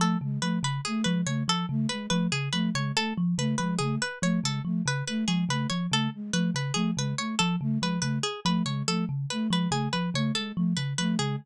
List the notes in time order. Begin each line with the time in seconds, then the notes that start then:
0.00 F3 A3 A4
0.21 C#3 G#3
0.42 F3 A3 B4
0.63 C#3 B4
0.85 A3 G#4
1.04 F3 G#3 B4
1.26 C#3 A3 C#5
1.48 F3 A4
1.69 C#3 A3
1.89 G#3 B4
2.10 F3 A3 B4
2.32 C#3 G#4
2.53 F3 A3 B4
2.75 C#3 G#3 C#5
2.96 A3 A4
3.18 F3
3.38 C#3 A3 B4
3.58 F3 G#3 B4
3.79 C#3 A3 G#4
4.02 B4
4.22 F3 A3 C#5
4.43 C#3 G#3 A4
4.65 F3 A3
4.86 C#3 B4
5.07 A3 B4
5.27 F3 G#3 G#4
5.49 C#3 A3 B4
5.70 F3 C#5
5.91 C#3 A3 A4
6.14 G#3
6.33 F3 A3 B4
6.54 C#3 B4
6.74 F3 A3 G#4
6.97 C#3 G#3 B4
7.18 A3 C#5
7.39 F3 A4
7.61 C#3 A3
7.80 F3 G#3 B4
8.01 C#3 A3 B4
8.23 G#4
8.45 F3 A3 B4
8.66 C#3 G#3 C#5
8.88 F3 A3 A4
9.09 C#3
9.30 A3 B4
9.50 F3 G#3 B4
9.71 C#3 A3 G#4
9.93 F3 B4
10.14 C#3 A3 C#5
10.35 G#3 A4
10.56 F3 A3
10.77 C#3 B4
10.98 F3 A3 B4
11.19 C#3 G#3 G#4